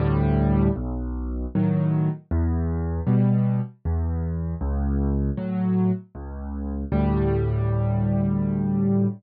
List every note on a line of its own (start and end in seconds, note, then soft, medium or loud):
0.00 0.69 D2 loud
0.00 0.69 A2 loud
0.00 0.69 G3 loud
0.76 1.45 B1 loud
1.55 2.09 A2 medium
1.55 2.09 D#3 medium
1.55 2.09 F#3 medium
2.31 3.00 E2 loud
3.07 3.60 B2 medium
3.07 3.60 G3 medium
3.85 4.54 E2 loud
4.61 5.30 C#2 loud
5.37 5.91 A2 medium
5.37 5.91 F#3 medium
6.15 6.84 C#2 loud
6.92 9.07 D2 loud
6.92 9.07 A2 medium
6.92 9.07 G3 loud